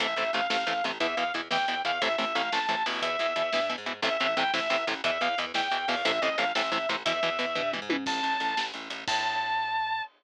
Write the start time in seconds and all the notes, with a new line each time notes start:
0.00 A1 C3 E3 A3 E5, kick, closed hi-hat
0.16 A1 C3 E3 A3 E5, closed hi-hat
0.33 A1 C3 E3 A3 F5, closed hi-hat
0.50 A1 C3 E3 A3 F5, snare
0.67 A1 C3 E3 A3, closed hi-hat
0.84 A1 C3 E3 A3, closed hi-hat
1.00 E2 B2 E3 E5, kick, closed hi-hat
1.17 E2 B2 E3 F5, closed hi-hat
1.34 E2 B2 E3, closed hi-hat
1.51 E2 B2 E3 G5, snare
1.68 E2 B2 E3, closed hi-hat
1.85 E2 B2 E3 F5, closed hi-hat
2.01 A1 A2 C3 E3 E5, kick, closed hi-hat
2.18 A1 A2 C3 E3 E5, closed hi-hat
2.35 A1 A2 C3 E3 F5, closed hi-hat
2.52 A1 A2 C3 E3 A5, snare
2.69 A1 A2 C3 E3, closed hi-hat
2.86 A1 B2 E3, open hi-hat
3.02 E2 E5, kick, closed hi-hat
3.19 E2 B2 E3, closed hi-hat
3.36 E2 B2 E3, closed hi-hat
3.53 G2 B2 E3, snare
3.69 B2 E3, closed hi-hat
3.78 G#2
3.86 B2 E3, closed hi-hat
4.02 A1 A2 C3 E3 E5, kick, closed hi-hat
4.20 A1 A2 C3 E3 E5, closed hi-hat
4.37 A1 A2 C3 E3 G5, closed hi-hat
4.54 A1 A2 C3 E3 E5, snare
4.70 A1 A2 C3 E3, closed hi-hat
4.87 A1 A2 C3 E3, closed hi-hat
5.04 E2 B2 E3 E5, kick, closed hi-hat
5.21 E2 B2 E3 F5, closed hi-hat
5.38 E2 B2 E3, closed hi-hat
5.54 E2 B2 E3 G5, snare
5.71 E2 B2 E3, closed hi-hat
5.88 E2 B2 E3 F5, open hi-hat
6.05 A1 A2 C3 E3 E5, kick, closed hi-hat
6.22 A1 A2 C3 E3 D#5, closed hi-hat
6.38 A1 A2 C3 E3 F5, closed hi-hat
6.55 A1 A2 C3 E3 E5, snare
6.72 A1 A2 C3 E3, closed hi-hat
6.89 A1 A2 C3 E3, closed hi-hat
7.05 E2 B2 E3 E5, kick, closed hi-hat
7.23 E2 B2 E3, closed hi-hat
7.39 E2 B2 E3, closed hi-hat
7.55 G2 B2 E3, kick, floor tom
7.73 B2 E3, mid tom
7.82 G#2
7.89 B2 E3, high tom
8.06 A1 A5, kick, crash
8.23 A1, closed hi-hat
8.40 A1, closed hi-hat
8.57 A1, snare
8.74 A1, closed hi-hat
8.90 A1, closed hi-hat
9.08 A2 A5, kick, crash